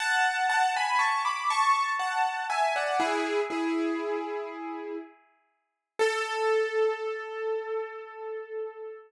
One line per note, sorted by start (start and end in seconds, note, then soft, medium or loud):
0.00 0.47 F#5 medium
0.00 0.47 A5 medium
0.49 0.73 F#5 medium
0.49 0.73 A5 medium
0.76 1.00 G#5 medium
0.76 1.00 B5 medium
0.99 1.23 A5 medium
0.99 1.23 C#6 medium
1.25 1.49 B5 medium
1.25 1.49 D6 medium
1.50 1.92 A5 medium
1.50 1.92 C#6 medium
1.99 2.46 F#5 medium
1.99 2.46 A5 medium
2.50 2.74 E5 medium
2.50 2.74 G#5 medium
2.76 3.00 D5 medium
2.76 3.00 F#5 medium
3.00 3.40 E4 medium
3.00 3.40 G#4 medium
3.50 4.97 E4 medium
3.50 4.97 G#4 medium
5.99 8.97 A4 loud